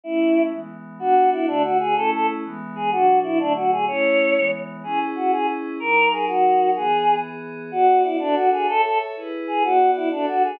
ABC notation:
X:1
M:6/8
L:1/8
Q:3/8=125
K:Bdor
V:1 name="Choir Aahs"
E3 z3 | F2 E D F G | A A z3 G | F2 E D F G |
c4 z2 | [K:C#dor] G z F G z2 | A2 G F3 | G3 z3 |
[K:Bdor] F2 E D F G | A A z3 G | F2 E D F G |]
V:2 name="Pad 5 (bowed)"
[A,CE]3 [E,G,B,]3 | [B,DF]3 [D,A,F]3 | [A,CE]3 [E,G,B,]3 | [B,,F,D]3 [D,F,A,]3 |
[A,CE]3 [E,G,B,]3 | [K:C#dor] [CEG]6 | [F,DA]6 | [E,B,G]6 |
[K:Bdor] [B,Fd]3 [DFA]3 | [Ace]3 [EGB]3 | [B,Fd]3 [DFA]3 |]